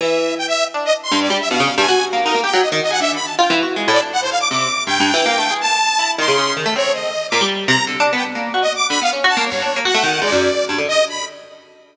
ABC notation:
X:1
M:6/4
L:1/16
Q:1/4=160
K:none
V:1 name="Orchestral Harp"
E,4 z4 D2 z2 G,,2 G, z B,, _D, z G,, (3_G2 G2 _B,2 | _E _B, G _G, z _E, z _A D,2 z2 (3F2 =E,2 _G2 (3_A,2 =A,,2 D2 z4 | C,2 z2 (3G,,2 G,,2 E,2 (3_B,2 A,2 _A2 z4 E2 _E, _D, D,2 E, =A, | C4 z2 _B,, G,3 C, z (3D,2 D2 =B,2 z _B,2 _G z3 D, |
(3B,2 _D2 _G2 (3_B,2 =G,,2 =D2 B, _G A, _E,2 _A,, _G,,2 z2 =G,, D, z4 |]
V:2 name="Lead 2 (sawtooth)"
e4 g e2 z2 _e z c'2 d2 =e f3 _a3 z2 | _B2 g2 _e z e _g (3=e2 =b2 a2 =g2 z4 d z _g c f d' | d'4 g8 a6 c'4 z2 | _d2 _e4 =d'2 z2 _b2 z3 g z4 (3e2 d'2 =b2 |
f z2 a2 _d4 _g4 =d5 z2 _e2 b2 |]